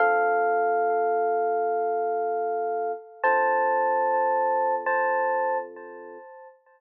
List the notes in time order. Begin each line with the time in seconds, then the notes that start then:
0.00 D3 C4 F4 A4 F5
3.23 D3 C4 F4 A4 C5 A5
4.86 C5 A5